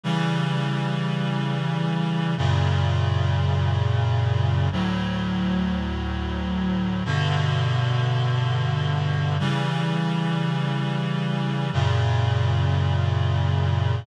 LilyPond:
\new Staff { \clef bass \time 3/4 \key b \minor \tempo 4 = 77 <cis e g>2. | <fis, ais, cis>2. | <d, a, fis>2. | <g, b, d>2. |
<cis e g>2. | <fis, ais, cis>2. | }